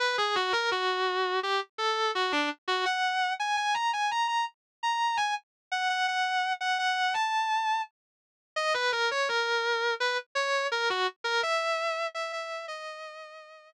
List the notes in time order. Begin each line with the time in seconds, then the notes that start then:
0.00 B4
0.18 G#4
0.35 F#4
0.53 A#4
0.71 F#4
1.43 G4
1.78 A4
2.15 F#4
2.32 D4
2.68 F#4
2.85 F#5
3.40 G#5
3.57 G#5
3.74 A#5
3.93 G#5
4.11 A#5
4.28 A#5
4.83 A#5
5.17 G#5
5.72 F#5
5.89 F#5
6.08 F#5
6.61 F#5
6.79 F#5
7.14 A5
8.56 D#5
8.74 B4
8.92 A#4
9.11 C#5
9.29 A#4
10.00 B4
10.35 C#5
10.72 A#4
10.90 F#4
11.24 A#4
11.43 E5
12.15 E5
12.32 E5
12.68 D#5